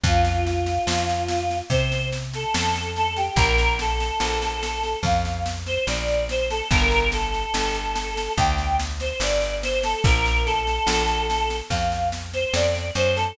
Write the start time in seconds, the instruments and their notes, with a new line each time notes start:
0.03 electric bass (finger) F2, choir aahs F4, kick, snare
0.25 snare
0.45 choir aahs F4, snare
0.66 snare
0.87 electric bass (finger) F2, snare
1.09 snare
1.28 snare
1.51 snare
1.70 electric bass (finger) C3, choir aahs C5, kick, snare
1.92 snare
2.12 snare
2.34 choir aahs A4, snare
2.55 electric bass (finger) F2, choir aahs A4, snare
2.75 snare
2.96 choir aahs A4, snare
3.16 choir aahs G4, snare
3.36 electric bass (finger) A#1, choir aahs A#4, kick, snare
3.58 snare
3.79 choir aahs A4, snare
4.00 snare
4.20 electric bass (finger) A#1, snare
4.42 snare
4.63 snare
4.84 snare
5.03 electric bass (finger) F2, choir aahs F5, kick, snare
5.25 snare
5.46 snare
5.66 choir aahs C5, snare
5.87 electric bass (finger) A#1, choir aahs D5, snare
6.08 snare
6.29 choir aahs C5, snare
6.51 choir aahs A4, snare
6.71 electric bass (finger) G1, choir aahs A#4, kick, snare
6.91 snare
7.12 choir aahs A4, snare
7.34 snare
7.54 electric bass (finger) G1, snare
7.75 snare
7.95 snare
8.17 snare
8.37 electric bass (finger) D2, choir aahs G5, kick, snare
8.58 snare
8.80 snare
9.00 choir aahs C5, snare
9.20 electric bass (finger) G1, choir aahs D5, snare
9.42 snare
9.63 choir aahs C5, snare
9.83 choir aahs A4, snare
10.04 electric bass (finger) A#1, choir aahs A#4, kick, snare
10.26 snare
10.45 choir aahs A4, snare
10.67 snare
10.87 electric bass (finger) A#1, snare
11.08 snare
11.30 snare
11.50 snare
11.70 electric bass (finger) F2, choir aahs F5, kick, snare
11.92 snare
12.12 snare
12.34 choir aahs C5, snare
12.53 electric bass (finger) F2, choir aahs D5, snare
12.75 snare
12.95 electric bass (finger) F#2, choir aahs C5, snare
13.16 choir aahs A4, snare